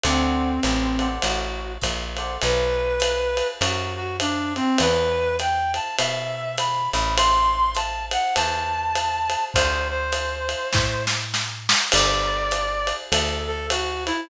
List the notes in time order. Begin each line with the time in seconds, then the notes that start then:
0.04 D2 C4 A4 C5 D5 F#5, ride
0.63 A1, hi-hat pedal, ride
0.99 A4 C5 D5 F#5, ride
1.22 A1 F#4, ride
1.82 A#1, kick, hi-hat pedal, ride
2.17 A4 C5 D5 F#5, ride
2.42 B1 B4, ride
3.00 hi-hat pedal, ride
3.37 ride
3.61 F#2 F#4, ride
3.96 F#4
4.20 D4, hi-hat pedal, ride
4.56 C4, ride
4.78 E2 B4, ride
5.39 G5, hi-hat pedal, ride
5.74 A5, ride
5.98 B2 E5, ride
6.58 B5, hi-hat pedal, ride
6.93 A1 B5, ride
7.17 C6, ride
7.75 A5, hi-hat pedal, ride
8.11 F#5, ride
8.35 E2 A5, ride
8.96 hi-hat pedal, ride
9.30 ride
9.54 D2 C5, kick, ride
9.90 C5
10.12 hi-hat pedal, ride
10.49 ride
10.73 A2, kick, snare
11.07 snare
11.34 snare
11.69 snare
11.92 G1 D5, crash, ride
12.51 hi-hat pedal, ride
12.87 ride
13.11 D2 A4, ride
13.47 A4
13.70 F#4, hi-hat pedal, ride
14.06 E4, ride